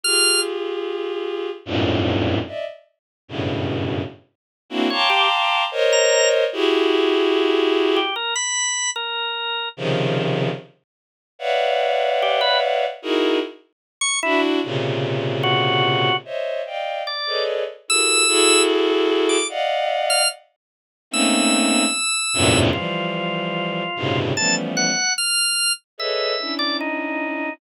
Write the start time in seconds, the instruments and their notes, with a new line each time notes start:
0.03 violin F4 G4 G#4, drawbar organ F6
1.65 violin F2 F#2 G2 G#2 A2 A#2
2.47 violin D5 D#5 E5
3.28 violin F#2 G2 A2 B2 C#3
4.70 violin A#3 C4 D4 E4 F#4
4.90 drawbar organ C#5, violin F5 G5 A5 A#5 C6 D6
5.10 drawbar organ G4
5.71 violin A#4 C5 C#5 D#5
5.92 drawbar organ A#5
6.53 violin E4 F#4 G4 G#4
7.96 drawbar organ G4
8.16 drawbar organ A#4
8.35 drawbar organ B5
8.96 drawbar organ A#4
9.77 violin C3 C#3 D#3 F3
11.39 violin B4 C#5 D5 E5 F5 F#5
12.22 drawbar organ G4
12.41 drawbar organ B4
13.02 violin D#4 E4 F#4 G#4 A#4
14.01 drawbar organ C#6
14.23 violin D4 E4 F#4, drawbar organ E4
14.64 violin A#2 C3 C#3
15.43 drawbar organ F#4
16.25 violin C5 C#5 D#5 E5
16.66 violin D5 D#5 F5 G5
17.07 drawbar organ D5
17.27 violin G#4 A4 B4 C#5 D5 D#5
17.88 violin E4 F#4 G4 G#4 A4 A#4, drawbar organ E6
18.28 violin E4 F#4 G#4 A4
19.29 drawbar organ D6
19.49 violin D5 D#5 F5 F#5
20.10 drawbar organ F6
21.11 violin A3 A#3 C4 C#4 D#4, drawbar organ E6
22.34 violin E2 F#2 G2 A2 A#2 C3
22.73 violin E3 F3 G3, drawbar organ F4
23.96 violin G2 A2 B2 C3 C#3
24.36 violin E3 F3 G3 A3 B3 C#4, drawbar organ A5
24.77 drawbar organ F#5
25.18 drawbar organ F6
25.98 violin G#4 A4 B4 C#5 D#5, drawbar organ E5
26.39 violin C#4 D4 E4
26.59 drawbar organ D5
26.81 drawbar organ D#4